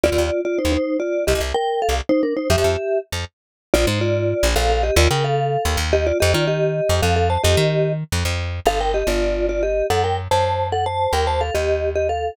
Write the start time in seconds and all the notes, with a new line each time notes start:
0.03 D#2 F4 D5
0.12 D#2
0.18 D#2
0.45 F4 D5
0.58 D#4 C5
0.65 D#2
0.72 D#4 C5
1.00 F4 D5
1.27 C2 G4 D#5
1.35 C2
1.40 C2
1.54 A#4 G5
1.82 A4 F5
1.89 C2
2.09 D#4 C5
2.23 D4 A#4
2.37 D#4 C5
2.50 F2 G4 E5
2.58 F2
2.64 F2
3.12 F2
3.74 A#1 F4 D5
3.87 G#2 D#4 C5
4.01 F4 D5
4.43 A#1
4.56 A#1 A4 F5
4.70 A4 F5
4.83 G4 D#5
4.96 D#2 F4 D5
5.11 C#3 A#4 G5
5.24 A4 F5
5.65 D#2
5.77 D#2
5.93 G4 D#5
6.07 F4 D5
6.20 F2 G4 D#5
6.34 D#3 F4 D5
6.47 G4 D#5
6.89 F2
7.02 F2 A4 F5
7.16 A4 F5
7.30 C5 A5
7.43 F2 G4 D#5
7.57 D#3
8.12 F2
8.25 F2
8.65 G1 A4 F5
8.80 A#4 G5
8.94 G4 D#5
9.07 G1 F4 D5
9.49 F4 D5
9.63 G4 D#5
9.90 F#2 A4 F#5
10.04 A#4 G5
10.31 F#2 C5 A5
10.72 A4 F#5
10.86 C5 A5
11.13 D#2 A#4 G5
11.27 C5 A5
11.41 A4 F5
11.54 D#2 G4 D#5
11.95 G4 D#5
12.09 A4 F5